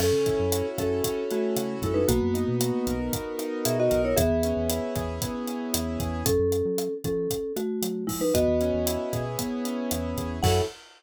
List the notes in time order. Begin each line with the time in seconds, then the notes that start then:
0.00 F#2 C#4 A4, cross-stick, crash
0.12 C#3
0.26 E4, kick, closed hi-hat
0.39 F#2
0.52 F#4, closed hi-hat
0.78 F#2 C#4 A4, kick, cross-stick, closed hi-hat
1.04 C#4, kick, closed hi-hat
1.31 A3 E4 F#4, closed hi-hat
1.56 C#3 F#4, cross-stick, closed hi-hat
1.82 F#2 G#3 E4 A4, kick, closed hi-hat
1.94 D#4 B4
2.08 B1 A#3 B3 F#4, kick, closed hi-hat
2.22 F#2
2.34 D#4, closed hi-hat
2.48 B2
2.60 F#4, cross-stick, closed hi-hat
2.87 B1 A#4, kick, closed hi-hat
3.13 B3, kick, closed hi-hat
3.39 D#4, cross-stick, closed hi-hat
3.65 B2 F#4 G#4 E5, closed hi-hat
3.80 F#4 D#5
3.91 B1 A#4, kick, closed hi-hat
4.05 E4 C#5
4.17 E2 B3 G#4 E5, kick, cross-stick, closed hi-hat
4.30 E2
4.43 C#4, closed hi-hat
4.57 E2
4.69 E4, closed hi-hat
4.96 E2 G#4, kick, cross-stick, closed hi-hat
5.22 B3, kick, closed hi-hat
5.47 C#4, closed hi-hat
5.73 E2 E4, cross-stick, closed hi-hat
6.00 E2 G#4, kick, closed hi-hat
6.26 F#2 C#4 A4, kick, closed hi-hat
6.39 F#2
6.52 closed hi-hat
6.65 F#3
6.78 cross-stick, closed hi-hat
7.04 F3 C#4 A4, kick, closed hi-hat
7.30 kick, closed hi-hat
7.56 A3 F#4, cross-stick, closed hi-hat
7.82 F#3, closed hi-hat
8.07 F3 G#3 E4, kick, open hi-hat
8.21 D#4 B4
8.34 E2 B3 F#4 D#5, kick, cross-stick, closed hi-hat
8.48 E2
8.61 C#4, closed hi-hat
8.74 E2
8.86 E4, closed hi-hat
9.13 B2 G#4, kick, cross-stick, closed hi-hat
9.39 B3, kick, closed hi-hat
9.65 C#4, closed hi-hat
9.91 E2 E4, cross-stick, closed hi-hat
10.17 E2 G#4, kick, closed hi-hat
10.43 F#2 C#4 E4 F#4 A4 F#5, kick, crash